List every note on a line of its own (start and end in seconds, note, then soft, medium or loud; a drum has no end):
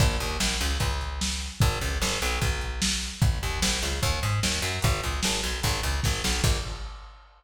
0.00 0.17 A#1 medium
0.00 kick loud
0.00 crash loud
0.20 0.37 D#2 medium
0.20 closed hi-hat medium
0.40 0.57 A#1 medium
0.40 snare loud
0.60 0.78 C#2 medium
0.60 closed hi-hat medium
0.80 1.49 C#2 medium
0.80 kick medium
0.80 closed hi-hat loud
1.01 closed hi-hat medium
1.21 snare loud
1.41 closed hi-hat medium
1.60 1.79 G#1 loud
1.60 kick loud
1.60 closed hi-hat loud
1.81 1.99 C#2 medium
1.81 closed hi-hat medium
2.02 2.19 G#1 medium
2.02 snare loud
2.22 2.39 B1 medium
2.22 closed hi-hat medium
2.42 3.10 B1 medium
2.42 kick medium
2.42 closed hi-hat loud
2.61 closed hi-hat medium
2.82 snare loud
3.02 closed hi-hat medium
3.22 3.39 A#1 medium
3.22 kick loud
3.22 closed hi-hat loud
3.43 3.60 D#2 medium
3.43 closed hi-hat medium
3.62 3.79 A#1 medium
3.62 snare loud
3.82 4.00 C#2 medium
3.82 closed hi-hat medium
4.03 4.20 D#2 medium
4.03 kick medium
4.03 closed hi-hat loud
4.23 4.40 G#2 medium
4.23 closed hi-hat medium
4.43 4.60 D#2 medium
4.43 snare loud
4.62 4.79 F#2 medium
4.62 closed hi-hat medium
4.82 5.01 G#1 medium
4.82 kick loud
4.82 closed hi-hat loud
5.03 5.21 C#2 medium
5.03 closed hi-hat medium
5.23 5.41 G#1 medium
5.23 snare loud
5.43 5.61 B1 medium
5.43 closed hi-hat medium
5.63 5.81 G#1 medium
5.63 kick medium
5.63 closed hi-hat loud
5.83 6.00 C#2 medium
5.83 closed hi-hat medium
6.03 6.22 G#1 medium
6.03 kick medium
6.03 snare medium
6.24 6.41 B1 medium
6.24 snare loud
6.44 6.58 A#1 loud
6.44 kick loud
6.44 crash loud